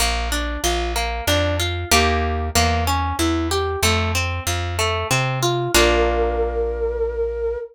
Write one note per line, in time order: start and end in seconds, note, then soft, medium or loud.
0.00 0.58 A#1 loud
0.00 0.29 A#3 medium
0.32 0.61 D4 medium
0.64 1.21 A#1 loud
0.64 0.93 F4 medium
0.96 1.24 A#3 medium
1.27 1.85 F2 loud
1.27 1.56 D4 loud
1.60 1.88 F4 medium
1.91 2.50 D#2 loud
1.91 2.49 A#3 loud
1.91 2.49 D#4 medium
1.91 2.49 G4 loud
2.55 3.13 E2 loud
2.55 2.84 A#3 loud
2.87 3.16 C#4 medium
3.19 3.76 E2 medium
3.19 3.48 E4 medium
3.51 3.80 G4 medium
3.83 4.40 F2 loud
3.83 4.12 A3 loud
4.15 4.44 C4 medium
4.47 5.04 F2 loud
4.47 4.76 F4 medium
4.79 5.07 A3 medium
5.11 5.68 C3 loud
5.11 5.39 C4 medium
5.43 5.71 F4 medium
5.74 7.56 A#1 loud
5.74 7.56 A#3 loud
5.74 7.56 D4 loud
5.74 7.56 F4 medium
5.74 7.58 A#4 loud